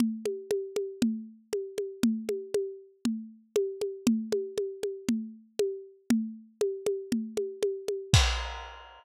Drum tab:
CC |--------|--------|--------|--------|
CG |OoooO-oo|Ooo-O-oo|OoooO-o-|O-ooOooo|
BD |--------|--------|--------|--------|

CC |x-------|
CG |--------|
BD |o-------|